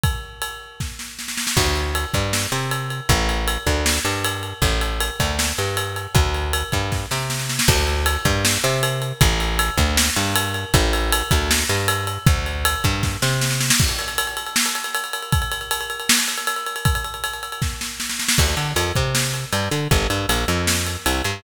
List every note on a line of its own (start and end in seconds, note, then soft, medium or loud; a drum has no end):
0.04 kick loud
0.04 ride medium
0.42 ride medium
0.80 kick medium
0.80 snare medium
0.99 snare medium
1.19 snare medium
1.28 snare medium
1.38 snare medium
1.47 snare medium
1.57 2.05 D2 loud
1.57 kick medium
1.57 crash medium
1.76 ride medium
1.95 ride medium
2.14 2.47 G2 medium
2.14 kick medium
2.14 ride medium
2.33 snare medium
2.52 3.01 C3 medium
2.52 ride medium
2.71 ride medium
2.90 ride medium
3.09 3.58 A1 loud
3.09 kick loud
3.09 ride medium
3.29 ride medium
3.48 ride medium
3.67 3.99 D2 medium
3.67 kick medium
3.67 ride medium
3.86 snare loud
4.05 4.53 G2 medium
4.05 ride medium
4.25 ride loud
4.43 ride medium
4.62 5.10 A1 medium
4.62 kick medium
4.62 ride medium
4.81 ride medium
5.00 ride loud
5.20 5.52 D2 medium
5.20 kick medium
5.20 ride medium
5.39 snare medium
5.58 6.07 G2 medium
5.58 ride medium
5.77 ride medium
5.96 ride medium
6.15 6.63 D2 medium
6.15 kick loud
6.15 ride medium
6.34 ride medium
6.53 ride loud
6.72 7.06 G2 medium
6.72 kick medium
6.72 ride medium
6.92 kick medium
6.92 snare medium
7.11 7.60 C3 medium
7.11 snare medium
7.30 snare medium
7.39 snare medium
7.49 snare medium
7.59 snare loud
7.68 8.17 D2 loud
7.68 kick loud
7.68 crash loud
7.87 ride medium
8.06 ride loud
8.25 8.58 G2 medium
8.25 kick medium
8.25 ride medium
8.45 snare loud
8.64 9.13 C3 medium
8.64 ride medium
8.83 ride loud
9.02 ride medium
9.21 9.70 A1 loud
9.21 kick loud
9.21 ride loud
9.40 ride medium
9.59 ride loud
9.78 10.10 D2 medium
9.78 kick medium
9.78 ride medium
9.97 snare loud
10.16 10.65 G2 medium
10.16 ride medium
10.36 ride loud
10.54 ride medium
10.74 11.23 A1 loud
10.74 kick loud
10.74 ride medium
10.93 ride medium
11.13 ride loud
11.31 11.64 D2 medium
11.31 kick medium
11.31 ride medium
11.51 snare loud
11.69 12.18 G2 medium
11.69 ride medium
11.88 ride loud
12.07 ride medium
12.27 12.76 D2 loud
12.27 kick loud
12.27 ride loud
12.46 ride medium
12.65 ride loud
12.84 13.17 G2 medium
12.84 kick medium
12.84 ride medium
13.03 kick medium
13.03 snare medium
13.22 13.71 C3 medium
13.22 snare medium
13.41 snare medium
13.51 snare medium
13.61 snare medium
13.70 snare loud
13.80 kick loud
13.80 crash loud
13.89 ride medium
13.99 ride medium
14.08 ride medium
14.18 ride loud
14.27 ride medium
14.37 ride medium
14.46 ride medium
14.56 snare loud
14.66 ride medium
14.75 ride medium
14.84 ride medium
14.95 ride loud
15.04 ride medium
15.13 ride medium
15.23 ride medium
15.32 kick loud
15.32 ride medium
15.42 ride medium
15.52 ride medium
15.61 ride medium
15.71 ride loud
15.81 ride medium
15.90 ride medium
16.00 ride medium
16.09 snare loud
16.19 ride medium
16.28 ride medium
16.38 ride medium
16.47 ride loud
16.56 ride medium
16.66 ride medium
16.76 ride medium
16.85 kick loud
16.85 ride loud
16.95 ride medium
17.05 ride medium
17.14 ride medium
17.24 ride medium
17.34 ride medium
17.43 ride medium
17.52 ride medium
17.62 kick medium
17.62 snare medium
17.81 snare medium
18.00 snare medium
18.10 snare medium
18.19 snare medium
18.29 snare loud
18.38 18.55 D2 medium
18.38 kick loud
18.38 crash loud
18.57 18.73 D3 medium
18.57 ride medium
18.76 18.92 F2 medium
18.76 ride loud
18.95 19.45 C3 medium
18.95 kick medium
18.95 ride medium
19.15 snare loud
19.34 ride medium
19.53 19.69 G2 medium
19.53 ride medium
19.71 19.88 D3 medium
19.71 ride medium
19.91 20.07 G1 medium
19.91 kick loud
19.91 ride medium
20.10 20.26 G2 medium
20.10 ride medium
20.29 20.45 A#1 medium
20.29 ride loud
20.48 20.97 F2 medium
20.48 ride medium
20.67 snare loud
20.87 ride medium
21.06 21.22 C2 medium
21.06 ride loud
21.24 21.41 G2 medium
21.24 ride medium